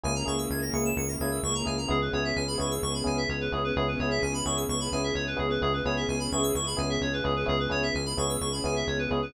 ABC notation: X:1
M:4/4
L:1/16
Q:1/4=129
K:C#phr
V:1 name="Electric Piano 1"
[^A,CEG]2 [A,CEG]4 [A,CEG]4 [A,CEG]4 [A,CEG]2 | [B,CEG]2 [B,CEG]4 [B,CEG]4 [B,CEG]4 [B,CEG]2 | [B,CEG]2 [B,CEG]4 [B,CEG]4 [B,CEG]4 [B,CEG]2 | [B,CEG]2 [B,CEG]4 [B,CEG]4 [B,CEG]4 [B,CEG]2 |
[B,CEG]2 [B,CEG]4 [B,CEG]4 [B,CEG]4 [B,CEG]2 |]
V:2 name="Electric Piano 2"
g ^a c' e' g' ^a' c'' e'' c'' a' g' e' c' a g a | G B c e g b c' e' c' b g e c B G B | G B c e g b c' e' c' b g e c B G B | G B c e g b c' e' c' b g e c B G B |
G B c e g b c' e' c' b g e c B G B |]
V:3 name="Synth Bass 1" clef=bass
C,,2 C,,2 C,,2 C,,2 C,,2 C,,2 C,,2 C,,2 | C,,2 C,,2 C,,2 C,,2 C,,2 C,,2 C,,2 C,,2 | C,,2 C,,2 C,,2 C,,2 C,,2 C,,2 C,,2 C,,2 | C,,2 C,,2 C,,2 C,,2 C,,2 C,,2 C,,2 C,,2 |
C,,2 C,,2 C,,2 C,,2 C,,2 C,,2 C,,2 C,,2 |]
V:4 name="String Ensemble 1"
[^A,CEG]16 | [B,CEG]16 | [B,CEG]16 | [B,CEG]16 |
[B,CEG]16 |]